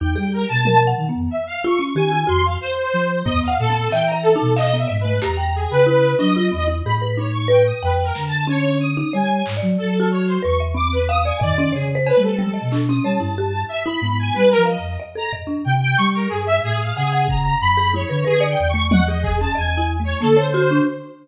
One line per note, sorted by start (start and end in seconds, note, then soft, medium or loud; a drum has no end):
0.00 0.15 E2 loud
0.00 0.16 D#4 medium
0.00 0.30 G5 medium
0.16 0.45 G3 medium
0.16 0.30 G#4 medium
0.33 0.48 A#4 medium
0.49 0.93 B2 medium
0.49 0.78 A5 loud
0.65 0.87 A#4 medium
0.65 high tom medium
0.87 1.07 F#5 loud
0.97 1.12 D#3 medium
1.09 1.29 B3 medium
1.14 1.29 F2 medium
1.31 1.45 E5 medium
1.47 1.62 F5 loud
1.64 1.79 F4 loud
1.64 1.93 C#6 medium
1.79 1.94 C#4 medium
1.95 2.24 D#3 medium
1.95 2.11 G4 medium
1.95 2.25 G#5 medium
2.11 2.26 F4 medium
2.27 2.57 F2 loud
2.27 2.42 F#4 medium
2.27 2.43 C6 loud
2.44 2.59 F5 medium
2.61 3.20 C5 loud
2.94 3.23 F3 medium
3.25 3.56 D#2 medium
3.25 3.45 B3 medium
3.25 3.40 D#5 loud
3.25 floor tom medium
3.43 3.58 F5 medium
3.48 3.67 F#5 loud
3.59 3.89 A#2 loud
3.59 3.89 A4 loud
3.70 3.89 C4 medium
3.91 4.35 E3 medium
3.91 4.11 E5 loud
3.91 4.07 G5 medium
3.91 clap medium
4.07 4.21 A#5 medium
4.12 4.31 E5 loud
4.23 4.52 A4 medium
4.36 4.55 D#4 loud
4.41 4.85 B2 medium
4.56 4.76 D#5 loud
4.56 4.71 F5 loud
4.56 clap medium
4.74 4.88 B3 medium
4.74 4.97 E5 medium
4.88 5.19 G#2 loud
4.88 5.02 D#5 medium
5.00 5.20 B4 medium
5.05 5.19 A3 medium
5.22 5.67 E2 medium
5.22 5.37 G4 medium
5.22 5.52 A#5 medium
5.22 closed hi-hat loud
5.37 5.81 G5 medium
5.56 5.71 G#4 medium
5.70 6.14 C#3 medium
5.70 5.85 B4 medium
5.87 6.16 E4 medium
5.87 6.17 B4 medium
6.18 6.49 F#3 medium
6.18 6.34 D4 medium
6.18 6.48 D#5 loud
6.36 6.51 F4 loud
6.52 6.82 E2 medium
6.52 6.66 C4 medium
6.52 6.67 D#5 medium
6.68 6.82 E4 medium
6.84 7.72 A2 medium
6.84 7.01 G#4 medium
6.84 7.14 B5 medium
7.02 7.16 B4 medium
7.17 7.47 D#4 medium
7.17 7.32 C#5 medium
7.33 7.48 C#6 medium
7.48 7.63 B4 loud
7.48 7.64 G5 medium
7.66 7.81 D#6 medium
7.82 8.12 F2 loud
7.82 8.03 B4 medium
7.82 8.12 G5 medium
8.04 8.24 A#4 medium
8.15 9.03 D3 medium
8.15 snare medium
8.27 8.47 A5 medium
8.47 8.91 C#4 loud
8.47 8.78 C#5 loud
8.80 9.10 D#6 medium
8.97 9.12 D#4 medium
9.13 9.43 G3 medium
9.13 9.52 C#5 medium
9.13 9.43 G#5 medium
9.46 9.61 G#2 medium
9.46 clap medium
9.57 9.96 D5 medium
9.62 9.77 F#3 loud
9.78 10.38 F#3 medium
9.78 10.07 A4 medium
10.00 10.39 F#4 loud
10.11 10.26 C#5 medium
10.27 10.41 C5 medium
10.43 11.32 E2 medium
10.43 10.57 B4 medium
10.43 10.59 C#6 medium
10.60 10.75 E5 medium
10.75 10.89 C4 medium
10.75 10.91 D6 medium
10.92 11.07 B4 medium
11.08 11.24 F5 loud
11.08 11.23 D#6 medium
11.25 11.40 D5 medium
11.25 11.40 G#5 medium
11.40 11.72 D#3 medium
11.40 11.70 D5 loud
11.40 11.54 D#5 loud
11.40 floor tom loud
11.58 11.73 C#4 loud
11.72 12.12 C#3 medium
11.72 11.88 G#4 medium
11.72 11.92 C#5 medium
11.95 12.15 C5 loud
12.07 12.22 B4 medium
12.07 cowbell loud
12.17 12.57 G3 medium
12.17 12.37 A3 medium
12.22 12.81 A4 medium
12.39 12.53 G#3 loud
12.39 high tom medium
12.54 12.68 D#5 medium
12.61 13.00 B2 medium
12.72 12.87 D4 medium
12.72 clap medium
12.89 13.04 C#4 loud
12.89 13.04 D#6 medium
13.04 13.18 G3 medium
13.04 13.19 C#5 medium
13.04 13.63 A5 medium
13.20 13.64 G2 medium
13.20 13.35 E4 medium
13.38 13.53 G4 medium
13.68 13.83 E5 medium
13.86 14.00 E4 loud
13.86 14.16 B5 medium
14.01 14.31 G#2 medium
14.01 14.32 B3 medium
14.19 14.34 G#5 medium
14.34 14.54 G3 medium
14.34 14.64 C4 medium
14.34 14.49 B4 loud
14.51 14.65 A#4 medium
14.57 14.77 F3 loud
14.65 14.98 D#5 medium
14.65 14.95 F5 medium
14.78 14.97 F2 medium
15.00 15.14 D#5 medium
15.15 15.30 A4 medium
15.15 15.32 A#5 medium
15.33 15.47 D#5 medium
15.33 floor tom medium
15.47 15.62 D4 medium
15.64 15.95 C3 medium
15.64 15.79 G5 medium
15.81 15.96 G5 loud
15.97 16.27 G3 loud
15.97 16.12 C#6 loud
15.97 closed hi-hat medium
16.14 16.29 A#4 medium
16.29 16.60 G2 medium
16.29 16.44 G#4 medium
16.46 16.61 E5 loud
16.63 16.92 A2 medium
16.63 16.78 G#4 loud
16.80 16.95 F5 medium
16.95 17.55 C#3 medium
16.95 17.25 G#4 loud
16.95 17.12 F#5 medium
17.13 17.57 F#5 medium
17.28 17.58 A#5 medium
17.28 kick medium
17.60 18.04 F#2 medium
17.60 17.90 B5 loud
17.77 17.92 G#4 medium
17.93 18.09 E4 medium
17.93 18.24 C#5 medium
17.93 high tom medium
18.09 18.24 D3 loud
18.09 18.24 B4 medium
18.25 18.55 D3 medium
18.25 18.46 G#4 loud
18.25 18.39 B4 loud
18.40 18.70 D5 loud
18.49 18.68 G5 medium
18.59 19.47 E2 loud
18.69 18.89 C#6 loud
18.74 18.89 A3 medium
18.91 19.07 D#5 medium
18.91 19.05 F#5 loud
18.91 high tom loud
19.07 19.38 G#4 medium
19.07 19.21 D#5 medium
19.23 19.37 G#4 medium
19.23 kick medium
19.40 19.56 C#4 medium
19.40 19.54 A5 medium
19.55 20.15 E2 medium
19.55 19.75 D#5 medium
19.55 19.86 G#5 loud
19.77 19.97 E4 medium
20.00 20.19 A3 medium
20.04 20.19 C#5 medium
20.21 20.80 D3 medium
20.21 20.35 A#3 medium
20.21 20.36 A4 loud
20.21 closed hi-hat medium
20.37 20.83 C5 medium
20.37 20.51 C#5 medium
20.54 20.69 F#4 loud
20.71 20.86 D4 loud